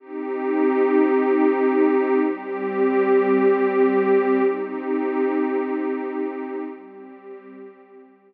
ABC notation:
X:1
M:4/4
L:1/8
Q:1/4=54
K:Cphr
V:1 name="Pad 2 (warm)"
[CEG]4 [G,CG]4 | [CEG]4 [G,CG]4 |]